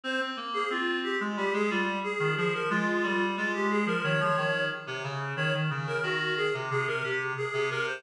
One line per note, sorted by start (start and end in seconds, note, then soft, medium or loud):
0.04 0.19 C4 medium
0.04 0.20 C5 loud
0.20 0.36 C4 medium
0.37 0.63 A#3 medium
0.54 0.69 G#4 loud
0.70 1.15 C4 medium
0.70 0.98 F4 loud
1.04 1.19 G4 medium
1.20 1.36 G#3 medium
1.37 1.53 G3 medium
1.37 1.53 G4 medium
1.53 1.69 G#3 medium
1.53 1.70 G#4 loud
1.70 1.99 G3 medium
1.70 1.86 F4 loud
2.03 2.33 G#4 medium
2.19 2.35 D#3 medium
2.37 2.69 F3 medium
2.37 2.53 G#4 loud
2.54 2.69 A#4 medium
2.70 2.86 G#3 loud
2.70 3.24 F4 loud
2.87 3.03 G#3 medium
3.03 3.35 G3 medium
3.37 3.83 G#3 medium
3.37 3.53 F4 loud
3.54 3.69 G4 medium
3.70 3.86 G#4 medium
3.86 4.02 F3 medium
3.86 4.03 A#4 loud
4.03 4.20 D#3 medium
4.03 4.63 C#5 loud
4.20 4.36 F3 medium
4.37 4.69 D#3 medium
4.87 5.03 C3 medium
5.03 5.33 C#3 medium
5.36 5.53 D#3 medium
5.36 5.52 C#5 loud
5.54 5.70 D#3 medium
5.70 5.98 C#3 medium
5.87 6.03 A#4 loud
6.03 6.46 D#3 medium
6.03 6.34 F#4 medium
6.37 6.53 G#4 medium
6.54 6.70 C3 medium
6.70 6.86 C3 medium
6.70 6.86 G#4 loud
6.87 7.02 C3 medium
6.87 7.03 A#4 medium
7.03 7.33 C3 medium
7.03 7.19 G4 medium
7.37 7.68 G#4 medium
7.53 7.69 C3 medium
7.70 8.00 C3 medium
7.70 7.86 A#4 medium
7.87 8.03 C5 medium